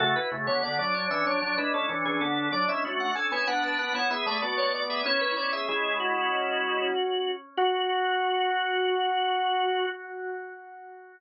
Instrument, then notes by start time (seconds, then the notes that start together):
drawbar organ
0.00 C#3 A3 F#4 A4
0.16 E4 B4
0.32 C#3 A3
0.47 D3 B3 C#5
0.63 D3 B3 D5
0.79 F#3 D4 D5
0.94 D4 C#5
1.10 E3 C#4 E5
1.26 F#3 D4 C#5
1.42 F#3 D4 C#5
1.58 G#3 D4 E4 B4
1.74 C#4 A4
1.89 E3 C#4 D4
2.05 E3 C#4 G#4
2.21 D3 B3 A4
2.52 F#3 D4 D5
2.68 G#3 C#4 E4 E5
2.85 A3 F#4
3.00 F#5
3.15 C#4 A4 G#5
3.31 B3 E4 C#5 G#5
3.47 B3 D4 B4 F#5
3.63 D4 B4 A5
3.79 D4 B4 F#5
3.94 B3 E4 C#5 F#5
4.11 B3 G#4 E5
4.26 A3 D5
4.42 B3 F#4 D5
4.58 C#5
4.74 D5
4.90 G#4 E5
5.05 C#4 E4 C#5
5.21 B4
5.36 E4 C#5 D5
5.53 G#4 E5
5.69 G#3 E4 G#4
6.00 F#4
7.57 F#4